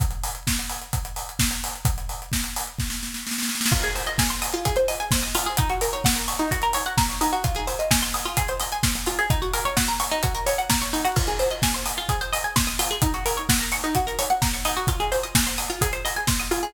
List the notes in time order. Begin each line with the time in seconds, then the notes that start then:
0.00 kick, closed hi-hat
0.11 closed hi-hat
0.23 open hi-hat
0.35 closed hi-hat
0.47 kick, snare
0.59 closed hi-hat
0.69 open hi-hat
0.82 closed hi-hat
0.93 kick, closed hi-hat
1.05 closed hi-hat
1.16 open hi-hat
1.29 closed hi-hat
1.39 kick, snare
1.51 closed hi-hat
1.64 open hi-hat
1.75 closed hi-hat
1.85 kick, closed hi-hat
1.98 closed hi-hat
2.09 open hi-hat
2.22 closed hi-hat
2.32 kick, snare
2.44 closed hi-hat
2.56 open hi-hat
2.67 closed hi-hat
2.78 kick, snare
2.90 snare
3.03 snare
3.14 snare
3.27 snare
3.31 snare
3.38 snare
3.43 snare
3.49 snare
3.55 snare
3.61 snare
3.66 snare
3.72 F4, kick, crash
3.83 G#4, closed hi-hat
3.95 C5, open hi-hat
4.06 D#5, closed hi-hat
4.18 G#5, kick, snare
4.30 C6, closed hi-hat
4.42 D#6, open hi-hat
4.53 F4, closed hi-hat
4.65 G#4, kick, closed hi-hat
4.76 C5, closed hi-hat
4.88 D#5, open hi-hat
5.00 G#5, closed hi-hat
5.11 C6, kick, snare
5.22 D#6, closed hi-hat
5.35 F4, open hi-hat
5.46 G#4, closed hi-hat
5.57 D#4, kick, closed hi-hat
5.70 F#4, closed hi-hat
5.81 A#4, open hi-hat
5.93 C#5, closed hi-hat
6.04 F#5, kick, snare
6.16 A#5, closed hi-hat
6.28 C#6, open hi-hat
6.39 D#4, closed hi-hat
6.51 F#4, kick, closed hi-hat
6.62 A#4, closed hi-hat
6.73 C#5, open hi-hat
6.86 F#5, closed hi-hat
6.97 A#5, kick, snare
7.09 C#6, closed hi-hat
7.21 D#4, open hi-hat
7.33 F#4, closed hi-hat
7.44 F4, kick, closed hi-hat
7.55 G#4, closed hi-hat
7.67 C5, open hi-hat
7.79 D#5, closed hi-hat
7.91 G#5, kick, snare
8.02 C6, closed hi-hat
8.14 D#6, open hi-hat
8.25 F4, closed hi-hat
8.37 G#4, kick, closed hi-hat
8.48 C5, closed hi-hat
8.60 D#5, open hi-hat
8.72 G#5, closed hi-hat
8.83 C6, kick, snare
8.95 D#6, closed hi-hat
9.06 F4, open hi-hat
9.19 G#4, closed hi-hat
9.30 D#4, kick, closed hi-hat
9.42 F#4, closed hi-hat
9.53 A#4, open hi-hat
9.65 C#5, closed hi-hat
9.77 F#5, kick, snare
9.88 A#5, closed hi-hat
10.00 C#6, open hi-hat
10.11 D#4, closed hi-hat
10.23 F#4, kick, closed hi-hat
10.35 A#4, closed hi-hat
10.46 C#5, open hi-hat
10.58 F#5, closed hi-hat
10.70 A#5, kick, snare
10.82 C#6, closed hi-hat
10.93 D#4, open hi-hat
11.05 F#4, closed hi-hat
11.16 F4, kick, crash
11.27 G#4, closed hi-hat
11.39 C5, open hi-hat
11.50 D#5, closed hi-hat
11.62 G#5, kick, snare
11.74 C6, closed hi-hat
11.86 D#6, open hi-hat
11.97 F4, closed hi-hat
12.09 G#4, kick, closed hi-hat
12.21 C5, closed hi-hat
12.33 D#5, open hi-hat
12.44 G#5, closed hi-hat
12.56 C6, kick, snare
12.67 D#6, closed hi-hat
12.79 F4, open hi-hat
12.91 G#4, closed hi-hat
13.02 D#4, kick, closed hi-hat
13.14 F#4, closed hi-hat
13.26 A#4, open hi-hat
13.37 C#5, closed hi-hat
13.49 F#5, kick, snare
13.59 A#5, closed hi-hat
13.72 C#6, open hi-hat
13.84 D#4, closed hi-hat
13.95 F#4, kick, closed hi-hat
14.07 A#4, closed hi-hat
14.19 C#5, open hi-hat
14.30 F#5, closed hi-hat
14.42 A#5, kick, snare
14.53 C#6, closed hi-hat
14.65 D#4, open hi-hat
14.77 F#4, closed hi-hat
14.87 F4, kick, closed hi-hat
15.00 G#4, closed hi-hat
15.12 C5, open hi-hat
15.23 D#5, closed hi-hat
15.35 G#5, kick, snare
15.47 C6, closed hi-hat
15.58 D#6, open hi-hat
15.70 F4, closed hi-hat
15.81 G#4, kick, closed hi-hat
15.93 C5, closed hi-hat
16.05 D#5, open hi-hat
16.16 G#5, closed hi-hat
16.27 C6, kick, snare
16.40 D#6, closed hi-hat
16.51 F4, open hi-hat
16.63 G#4, closed hi-hat